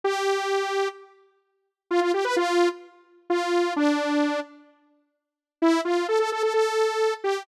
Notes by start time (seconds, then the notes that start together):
0.04 G4
1.91 F4
2.01 F4
2.14 G4
2.25 B4
2.36 F4
3.30 F4
3.76 D4
5.62 E4
5.85 F4
6.08 A4
6.19 A4
6.32 A4
6.43 A4
6.54 A4
7.24 G4